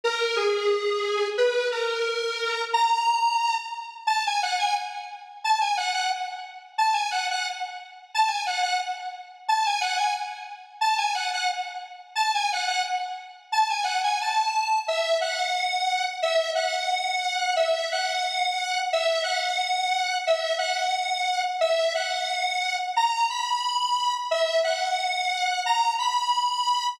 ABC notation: X:1
M:2/4
L:1/16
Q:1/4=89
K:B
V:1 name="Lead 1 (square)"
A2 G6 | B2 A6 | a6 z2 | [K:A] a g f g z4 |
a g f f z4 | a g f f z4 | a g f f z4 | a g f g z4 |
a g f f z4 | a g f f z4 | a g f g a4 | [K:B] e2 f6 |
e2 f6 | e2 f6 | e2 f6 | e2 f6 |
e2 f6 | a2 b6 | e2 f6 | a2 b6 |]